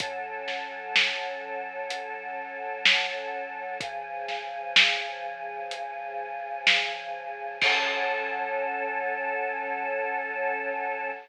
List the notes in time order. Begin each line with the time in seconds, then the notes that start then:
0.00 F#3 C#4 A4, kick, closed hi-hat
0.48 snare
0.96 snare
1.90 closed hi-hat
2.86 snare
3.81 C#3 F3 G#4, kick, closed hi-hat
4.28 snare
4.76 snare
5.71 closed hi-hat
6.67 snare
7.62 F#3 C#4 A4, kick, crash